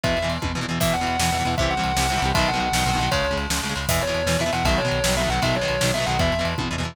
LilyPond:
<<
  \new Staff \with { instrumentName = "Distortion Guitar" } { \time 6/8 \key e \major \tempo 4. = 156 e''4 r2 | e''8 fis''8 fis''2 | e''8 fis''8 fis''2 | e''8 fis''8 fis''2 |
cis''4 r2 | e''8 cis''4. e''8 fis''8 | e''8 cis''4. e''8 fis''8 | e''8 cis''4. e''8 fis''8 |
e''4 r2 | }
  \new Staff \with { instrumentName = "Overdriven Guitar" } { \clef bass \time 6/8 \key e \major <b, e>8. <b, e>8. <b, e>8 <b, e>16 <b, e>16 <b, e>8 | <b, e>8. <b, e>8. <b, e>8 <b, e>16 <b, e>16 <b, e>8 | <c e g>8. <c e g>8. <c e g>8 <c e g>16 <c e g>16 <c e g>8 | <b, dis fis>8. <b, dis fis>8. <b, dis fis>8 <b, dis fis>16 <b, dis fis>16 <b, dis fis>8 |
<cis gis>8. <cis gis>8. <cis gis>8 <cis gis>16 <cis gis>16 <cis gis>8 | <b, e>8. <b, e>8. <b, e>8 <b, e>16 <b, e>16 <b, e>8 | <b, dis fis>8. <b, dis fis>8. <b, dis fis>8 <b, dis fis>16 <b, dis fis>16 <b, dis fis>8 | <b, dis fis>8. <b, dis fis>8. <b, dis fis>8 <b, dis fis>16 <b, dis fis>16 <b, dis fis>8 |
<b, e>8. <b, e>8. <b, e>8 <b, e>16 <b, e>16 <b, e>8 | }
  \new Staff \with { instrumentName = "Synth Bass 1" } { \clef bass \time 6/8 \key e \major e,8 e,8 e,8 e,8 e,8 e,8 | e,8 e,8 e,8 e,8 e,8 e,8 | c,8 c,8 c,8 c,8 c,8 c,8 | b,,8 b,,8 b,,8 b,,8 b,,8 b,,8 |
cis,8 cis,8 cis,8 cis,8 cis,8 cis,8 | e,8 e,8 e,8 e,8 e,8 e,8 | b,,8 b,,8 b,,8 b,,8 b,,8 b,,8 | b,,8 b,,8 b,,8 b,,8 b,,8 b,,8 |
e,8 e,8 e,8 e,8 e,8 e,8 | }
  \new DrumStaff \with { instrumentName = "Drums" } \drummode { \time 6/8 <bd cymr>8 cymr8 cymr8 <bd tommh>8 tomfh4 | <cymc bd>8 cymr8 cymr8 sn8 cymr8 cymr8 | <bd cymr>8 cymr8 cymr8 sn8 cymr8 cymr8 | <bd cymr>8 cymr8 cymr8 sn8 cymr8 cymr8 |
<bd cymr>8 cymr8 cymr8 sn8 cymr8 cymr8 | <cymc bd>8 cymr8 cymr8 sn8 cymr8 cymr8 | <bd cymr>8 cymr8 cymr8 sn8 cymr8 cymr8 | <bd cymr>8 cymr8 cymr8 sn8 cymr8 cymr8 |
<bd cymr>8 cymr8 cymr8 <bd tommh>8 tomfh4 | }
>>